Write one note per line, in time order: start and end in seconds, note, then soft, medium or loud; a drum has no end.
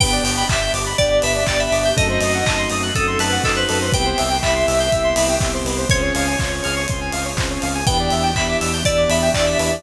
0.00 0.19 G1 medium
0.00 0.44 B3 loud
0.00 1.96 B3 loud
0.00 0.44 D4 loud
0.00 1.96 D4 medium
0.00 0.44 G4 loud
0.00 1.96 G4 loud
0.00 0.11 B4 medium
0.00 0.47 G5 medium
0.00 kick loud
0.00 crash loud
0.12 0.23 D5 medium
0.23 0.44 G1 medium
0.23 0.36 G5 medium
0.23 open hi-hat loud
0.37 0.48 B5 medium
0.49 0.70 G1 medium
0.49 0.93 B3 medium
0.49 0.93 D4 medium
0.49 0.93 G4 loud
0.49 0.72 E5 medium
0.49 0.60 D6 medium
0.49 kick loud
0.49 clap loud
0.61 0.73 G6 medium
0.73 0.94 G1 medium
0.73 0.85 D6 medium
0.73 open hi-hat medium
0.86 0.97 B5 medium
0.98 1.20 G1 medium
0.98 1.43 B3 medium
0.98 1.43 D4 loud
0.98 1.43 G4 medium
0.98 1.19 D5 medium
0.98 1.09 G5 medium
0.98 kick loud
0.98 closed hi-hat loud
1.11 1.22 D5 medium
1.22 1.44 G1 medium
1.22 1.34 B4 medium
1.22 1.43 E5 medium
1.22 open hi-hat medium
1.35 1.46 D5 medium
1.47 1.68 G1 medium
1.47 1.92 B3 loud
1.47 1.92 D4 loud
1.47 1.92 G4 loud
1.47 1.59 D5 medium
1.47 1.58 G5 medium
1.47 kick medium
1.47 clap loud
1.59 1.92 E5 medium
1.59 1.71 B5 medium
1.72 1.92 G1 medium
1.72 1.83 D6 medium
1.72 open hi-hat medium
1.85 1.96 G6 medium
1.97 2.18 F#2 loud
1.97 2.41 A3 loud
1.97 3.92 A3 medium
1.97 2.41 C4 loud
1.97 3.92 C4 medium
1.97 2.41 D#4 loud
1.97 3.92 D#4 loud
1.97 2.41 F#4 loud
1.97 3.92 F#4 medium
1.97 2.08 A4 medium
1.97 2.45 D#5 medium
1.97 kick loud
1.97 closed hi-hat loud
2.09 2.20 C5 medium
2.20 2.42 F#2 medium
2.20 2.32 D#5 medium
2.20 open hi-hat medium
2.34 2.45 F#5 medium
2.45 2.66 F#2 medium
2.45 2.90 A3 medium
2.45 2.90 C4 medium
2.45 2.90 D#4 medium
2.45 2.90 F#4 medium
2.45 2.68 D#5 medium
2.45 2.57 A5 medium
2.45 kick loud
2.45 clap loud
2.58 2.69 C6 medium
2.70 2.91 F#2 medium
2.70 2.82 D#6 medium
2.70 open hi-hat medium
2.83 2.94 F#6 medium
2.95 3.16 F#2 medium
2.95 3.39 A3 medium
2.95 3.39 C4 medium
2.95 3.39 D#4 medium
2.95 3.39 F#4 medium
2.95 3.19 A4 medium
2.95 3.06 D#6 medium
2.95 kick loud
2.95 closed hi-hat loud
3.07 3.18 C6 medium
3.18 3.39 F#2 medium
3.18 3.42 B4 medium
3.18 3.31 A5 medium
3.18 open hi-hat loud
3.32 3.43 F#5 medium
3.43 3.64 F#2 medium
3.43 3.89 A3 medium
3.43 3.89 C4 loud
3.43 3.89 D#4 loud
3.43 3.89 F#4 medium
3.43 3.56 A4 medium
3.43 3.55 D#5 medium
3.43 kick loud
3.43 clap loud
3.56 3.92 B4 medium
3.56 3.67 C5 medium
3.69 3.90 F#2 medium
3.69 3.80 A4 medium
3.69 open hi-hat medium
3.81 3.92 C5 medium
3.92 4.13 C2 medium
3.92 5.87 B3 medium
3.92 4.38 B3 loud
3.92 5.87 C4 medium
3.92 4.38 C4 loud
3.92 5.87 E4 medium
3.92 4.38 E4 loud
3.92 5.87 G4 loud
3.92 4.38 G4 loud
3.92 4.04 B4 medium
3.92 4.38 G5 medium
3.92 kick loud
3.92 closed hi-hat loud
4.06 4.17 C5 medium
4.18 4.41 C2 medium
4.18 4.29 E5 medium
4.18 open hi-hat medium
4.30 4.41 G5 medium
4.43 4.64 C2 medium
4.43 4.87 B3 medium
4.43 4.87 C4 medium
4.43 4.87 E4 medium
4.43 4.87 G4 loud
4.43 5.34 E5 medium
4.43 4.54 B5 medium
4.43 kick medium
4.43 clap loud
4.55 4.66 C6 medium
4.67 4.89 C2 medium
4.67 4.78 E6 medium
4.67 open hi-hat medium
4.80 4.91 G6 medium
4.92 5.14 C2 medium
4.92 5.36 B3 medium
4.92 5.36 C4 medium
4.92 5.36 E4 loud
4.92 5.36 G4 loud
4.92 5.03 E6 medium
4.92 kick medium
4.92 closed hi-hat loud
5.04 5.15 C6 medium
5.16 5.37 C2 medium
5.16 5.27 B5 medium
5.16 open hi-hat loud
5.29 5.40 G5 medium
5.40 5.62 C2 medium
5.40 5.85 B3 medium
5.40 5.85 C4 medium
5.40 5.85 E4 medium
5.40 5.85 G4 loud
5.40 5.52 E5 medium
5.40 kick loud
5.40 clap loud
5.54 5.65 C5 medium
5.64 5.85 C2 medium
5.64 5.77 B4 medium
5.64 open hi-hat medium
5.78 5.89 C5 medium
5.89 6.11 C#2 loud
5.89 7.83 C4 medium
5.89 6.34 C4 loud
5.89 7.83 C#4 medium
5.89 6.34 C#4 loud
5.89 7.83 F4 medium
5.89 6.34 F4 loud
5.89 7.83 G#4 medium
5.89 6.34 G#4 loud
5.89 6.01 C5 medium
5.89 6.85 C#5 medium
5.89 kick loud
5.89 closed hi-hat loud
6.02 6.13 C#5 medium
6.15 6.36 C#2 medium
6.15 6.26 F5 medium
6.15 open hi-hat medium
6.27 6.38 G#5 medium
6.39 6.61 C#2 medium
6.39 6.84 C4 medium
6.39 6.84 C#4 loud
6.39 6.84 F4 loud
6.39 6.84 G#4 medium
6.39 6.51 C6 medium
6.39 kick loud
6.39 clap loud
6.51 6.62 C#6 medium
6.64 6.86 C#2 medium
6.64 6.75 F6 medium
6.64 open hi-hat medium
6.76 6.87 C#6 medium
6.88 7.11 C#2 medium
6.88 7.33 C4 medium
6.88 7.33 C#4 medium
6.88 7.33 F4 medium
6.88 7.33 G#4 medium
6.88 7.00 C6 medium
6.88 kick loud
6.88 closed hi-hat loud
7.01 7.12 G#5 medium
7.12 7.34 C#2 medium
7.12 7.24 F5 medium
7.12 open hi-hat medium
7.25 7.36 C#5 medium
7.37 7.58 C#2 medium
7.37 7.82 C4 loud
7.37 7.82 C#4 medium
7.37 7.82 F4 loud
7.37 7.82 G#4 medium
7.37 7.49 C5 medium
7.37 kick loud
7.37 clap loud
7.50 7.61 C#5 medium
7.62 7.84 C#2 medium
7.62 7.73 F5 medium
7.62 open hi-hat medium
7.75 7.86 G#5 medium
7.87 8.09 E2 medium
7.87 9.82 B3 medium
7.87 8.31 B3 loud
7.87 9.82 D4 medium
7.87 8.31 D4 loud
7.87 9.82 E4 loud
7.87 8.31 E4 loud
7.87 9.82 G4 loud
7.87 8.31 G4 loud
7.87 7.98 B4 medium
7.87 8.34 G5 medium
7.87 kick loud
7.87 closed hi-hat loud
7.99 8.10 D5 medium
8.10 8.33 E2 medium
8.10 8.23 E5 medium
8.10 open hi-hat medium
8.23 8.34 G5 medium
8.35 8.56 E2 medium
8.35 8.80 B3 loud
8.35 8.80 D4 loud
8.35 8.80 E4 loud
8.35 8.80 G4 medium
8.35 8.57 E5 medium
8.35 8.47 B5 medium
8.35 kick medium
8.35 clap loud
8.48 8.60 D6 medium
8.61 8.83 E2 medium
8.61 8.72 E6 medium
8.61 open hi-hat medium
8.73 8.84 G6 medium
8.85 9.06 E2 medium
8.85 9.30 B3 medium
8.85 9.30 D4 loud
8.85 9.30 E4 medium
8.85 9.30 G4 medium
8.85 9.09 D5 medium
8.85 8.97 E6 medium
8.85 kick loud
8.85 closed hi-hat loud
8.97 9.08 D6 medium
9.09 9.30 E2 medium
9.09 9.30 E5 medium
9.09 9.21 B5 medium
9.09 open hi-hat medium
9.22 9.33 G5 medium
9.34 9.55 E2 medium
9.34 9.79 B3 medium
9.34 9.79 D4 medium
9.34 9.79 E4 medium
9.34 9.79 G4 loud
9.34 9.46 D5 medium
9.34 9.45 E5 medium
9.34 kick medium
9.34 clap loud
9.47 9.58 D5 medium
9.47 9.82 E5 medium
9.59 9.80 E2 medium
9.59 9.70 B4 medium
9.59 open hi-hat medium
9.71 9.82 D5 medium